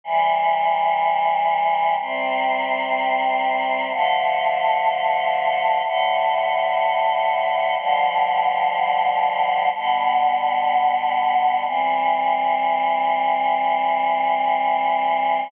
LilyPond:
\new Staff { \time 4/4 \key c \major \tempo 4 = 62 <c e g>2 <c g c'>2 | <d f a>2 <a, d a>2 | <b, d f g>2 <b, d g b>2 | <e g c'>1 | }